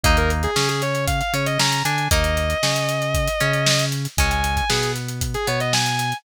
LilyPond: <<
  \new Staff \with { instrumentName = "Distortion Guitar" } { \time 4/4 \key bes \minor \tempo 4 = 116 ees''16 bes'16 r16 aes'8 aes'16 des''8 f''16 f''16 des''16 ees''16 bes''8 aes''8 | ees''1 | aes''16 aes''8 aes''16 aes'8 r8. aes'16 des''16 ees''16 aes''4 | }
  \new Staff \with { instrumentName = "Acoustic Guitar (steel)" } { \time 4/4 \key bes \minor <bes ees'>4 des'4. des'8 des'8 d'8 | <bes ees'>4 des'4. des'4. | <aes des'>4 b4. b4. | }
  \new Staff \with { instrumentName = "Synth Bass 1" } { \clef bass \time 4/4 \key bes \minor ees,4 des4. des8 des8 d8 | ees,4 des4. des4. | des,4 b,4. b,4. | }
  \new DrumStaff \with { instrumentName = "Drums" } \drummode { \time 4/4 <hh bd>16 hh16 hh16 hh16 sn16 hh16 hh16 hh16 <hh bd>16 hh16 hh16 hh16 sn16 hh16 hh16 hh16 | <hh bd>16 hh16 hh16 hh16 sn16 hh16 hh16 hh16 <hh bd>16 hh16 hh16 hh16 sn16 hh16 hh16 hh16 | <hh bd>16 hh16 hh16 <hh bd>16 sn16 hh16 hh16 hh16 <hh bd>16 hh16 hh16 hh16 sn16 hh16 hh16 hh16 | }
>>